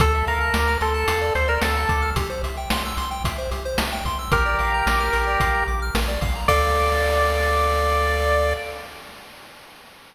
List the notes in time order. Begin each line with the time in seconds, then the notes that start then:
0.00 D2 A4, kick, closed hi-hat
0.15 E5
0.27 D2 A#4 F5, closed hi-hat
0.41 A5
0.54 D2 D6, snare
0.68 F6
0.81 D2 A4 C6, closed hi-hat
0.94 A5
1.08 E2 F5, closed hi-hat
1.21 D5
1.35 D2 A4 C5, closed hi-hat
1.48 A#4 D5
1.61 D2 A4 F5, snare
1.75 A5
1.89 D2 D6, kick, closed hi-hat
2.02 F6
2.16 C2 G4, kick, closed hi-hat
2.30 C5
2.43 C2 E5, closed hi-hat
2.57 G5
2.70 C2 C6, snare
2.85 E6
2.97 C2 C6, closed hi-hat
3.11 G5
3.24 C2 E5, kick, closed hi-hat
3.38 C5
3.51 C2 G4, closed hi-hat
3.65 C5
3.78 C2 E5, snare
3.92 G5
4.05 C2 C6, kick, closed hi-hat
4.19 E6
4.32 A#1 G4 A#4, kick, closed hi-hat
4.46 D5
4.59 A#1 F5, closed hi-hat
4.74 A#5
4.86 A#1 D6, snare
5.00 F6
5.13 A#1 A#4, closed hi-hat
5.27 D5
5.40 A#1 F5, kick, closed hi-hat
5.55 A#5
5.68 A#1 D6
5.82 F6
5.95 A#1 A#4, snare
6.08 D5
6.21 A#1 F5, kick, open hi-hat
6.35 A#5
6.48 D2 A4 D5 F5, kick, crash